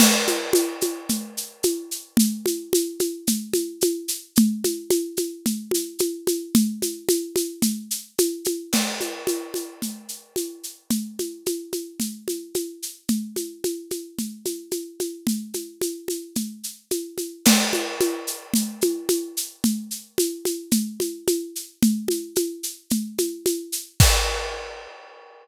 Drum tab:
CC |x-------|--------|--------|--------|
SH |xxxxxxxx|xxxxxxxx|xxxxxxxx|xxxxxxxx|
CG |OoooO-o-|OoooOoo-|OoooOooo|OoooO-oo|
BD |--------|--------|--------|--------|

CC |x-------|--------|--------|--------|
SH |xxxxxxxx|xxxxxxxx|xxxxxxxx|xxxxxxxx|
CG |OoooO-o-|OoooOoo-|OoooOooo|OoooO-oo|
BD |--------|--------|--------|--------|

CC |x-------|--------|--------|x-------|
SH |xxxxxxxx|xxxxxxxx|xxxxxxxx|--------|
CG |Ooo-Ooo-|O-ooOoo-|Ooo-Ooo-|--------|
BD |--------|--------|--------|o-------|